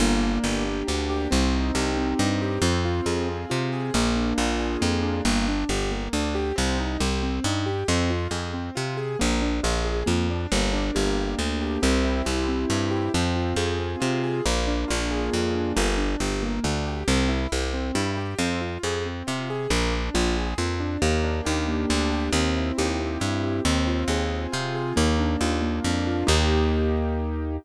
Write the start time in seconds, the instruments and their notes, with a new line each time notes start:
0.00 electric bass (finger) G1, acoustic grand piano A#3
0.23 acoustic grand piano D4
0.44 electric bass (finger) G1, acoustic grand piano G4
0.65 acoustic grand piano A#3
0.87 electric bass (finger) D2, acoustic grand piano D4
1.09 acoustic grand piano G4
1.31 electric bass (finger) C2, acoustic grand piano C4
1.53 acoustic grand piano D#4
1.75 electric bass (finger) C2, acoustic grand piano G4
1.97 acoustic grand piano C4
2.19 electric bass (finger) G2, acoustic grand piano D#4
2.42 acoustic grand piano G4
2.62 electric bass (finger) F2, acoustic grand piano C4
2.85 acoustic grand piano F4
3.06 electric bass (finger) F2, acoustic grand piano G#4
3.29 acoustic grand piano C4
3.50 electric bass (finger) C3, acoustic grand piano F4
3.72 acoustic grand piano G#4
3.94 electric bass (finger) A#1, acoustic grand piano A#3
4.16 acoustic grand piano D4
4.38 electric bass (finger) A#1, acoustic grand piano F4
4.60 acoustic grand piano G#4
4.81 electric bass (finger) F2, acoustic grand piano A#3
5.02 acoustic grand piano D4
5.25 electric bass (finger) G1, acoustic grand piano A#3
5.48 acoustic grand piano D4
5.69 electric bass (finger) G1, acoustic grand piano G4
5.92 acoustic grand piano A#3
6.13 electric bass (finger) D2, acoustic grand piano D4
6.35 acoustic grand piano G4
6.56 electric bass (finger) C2, acoustic grand piano C4
6.78 acoustic grand piano D#4
7.00 electric bass (finger) C2, acoustic grand piano G4
7.23 acoustic grand piano C4
7.44 electric bass (finger) G2, acoustic grand piano D#4
7.66 acoustic grand piano G4
7.88 electric bass (finger) F2, acoustic grand piano C4
8.10 acoustic grand piano F4
8.31 electric bass (finger) F2, acoustic grand piano G#4
8.54 acoustic grand piano C4
8.75 electric bass (finger) C3, acoustic grand piano F4
8.97 acoustic grand piano G#4
9.19 electric bass (finger) A#1, acoustic grand piano A#3
9.42 acoustic grand piano D4
9.63 electric bass (finger) A#1, acoustic grand piano F4
9.85 acoustic grand piano G#4
10.06 electric bass (finger) F2, acoustic grand piano A#3
10.30 acoustic grand piano D4
10.52 electric bass (finger) G1, acoustic grand piano A#3
10.73 acoustic grand piano D4
10.95 electric bass (finger) G1, acoustic grand piano G4
11.18 acoustic grand piano A#3
11.38 electric bass (finger) D2, acoustic grand piano D4
11.61 acoustic grand piano G4
11.82 electric bass (finger) C2, acoustic grand piano C4
12.04 acoustic grand piano E4
12.25 electric bass (finger) C2, acoustic grand piano G4
12.48 acoustic grand piano C4
12.70 electric bass (finger) G2, acoustic grand piano E4
12.91 acoustic grand piano G4
13.14 electric bass (finger) F2, acoustic grand piano C4
13.36 acoustic grand piano F4
13.56 electric bass (finger) F2, acoustic grand piano G#4
13.79 acoustic grand piano C4
14.00 electric bass (finger) C3, acoustic grand piano F4
14.23 acoustic grand piano G#4
14.45 electric bass (finger) A#1, acoustic grand piano A#3
14.68 acoustic grand piano D4
14.88 electric bass (finger) A#1, acoustic grand piano F4
15.11 acoustic grand piano G#4
15.33 electric bass (finger) F2, acoustic grand piano A#3
15.55 acoustic grand piano D4
15.76 electric bass (finger) G1, acoustic grand piano A#3
15.98 acoustic grand piano D4
16.20 electric bass (finger) G1, acoustic grand piano G4
16.43 acoustic grand piano A#3
16.64 electric bass (finger) D2, acoustic grand piano D4
16.86 acoustic grand piano G4
17.08 electric bass (finger) C2, acoustic grand piano C4
17.29 acoustic grand piano E4
17.52 electric bass (finger) C2, acoustic grand piano G4
17.74 acoustic grand piano C4
17.95 electric bass (finger) G2, acoustic grand piano E4
18.17 acoustic grand piano G4
18.39 electric bass (finger) F2, acoustic grand piano C4
18.61 acoustic grand piano F4
18.83 electric bass (finger) F2, acoustic grand piano G#4
19.06 acoustic grand piano C4
19.27 electric bass (finger) C3, acoustic grand piano F4
19.50 acoustic grand piano G#4
19.70 electric bass (finger) A#1, acoustic grand piano A#3
19.93 acoustic grand piano D4
20.14 electric bass (finger) A#1, acoustic grand piano F4
20.37 acoustic grand piano G#4
20.58 electric bass (finger) F2, acoustic grand piano A#3
20.80 acoustic grand piano D4
21.02 electric bass (finger) D#2, acoustic grand piano A#3
21.24 acoustic grand piano D4
21.45 electric bass (finger) D#2, acoustic grand piano G4
21.68 acoustic grand piano A#3
21.90 electric bass (finger) D2, acoustic grand piano D4
22.12 acoustic grand piano G4
22.32 electric bass (finger) D#2, acoustic grand piano C4
22.56 acoustic grand piano E4
22.78 electric bass (finger) D#2, acoustic grand piano G4
23.00 acoustic grand piano C4
23.20 electric bass (finger) G2, acoustic grand piano E4
23.43 acoustic grand piano G4
23.65 electric bass (finger) D#2, acoustic grand piano C4
23.87 acoustic grand piano F4
24.08 electric bass (finger) D#2, acoustic grand piano G#4
24.31 acoustic grand piano C4
24.52 electric bass (finger) C3, acoustic grand piano F4
24.75 acoustic grand piano G#4
24.96 electric bass (finger) D#2, acoustic grand piano A#3
25.19 acoustic grand piano D4
25.41 electric bass (finger) D#2, acoustic grand piano F4
25.62 acoustic grand piano A#3
25.84 electric bass (finger) F2, acoustic grand piano D4
26.07 acoustic grand piano F4
26.27 electric bass (finger) D#2, acoustic grand piano A#3 D#4 G4